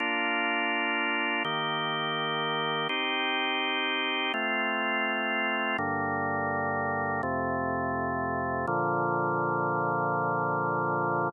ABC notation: X:1
M:4/4
L:1/8
Q:1/4=83
K:Bb
V:1 name="Drawbar Organ"
[B,DF]4 [E,B,G]4 | [CEG]4 [A,CF]4 | [G,,D,B,]4 [F,,C,A,]4 | [B,,D,F,]8 |]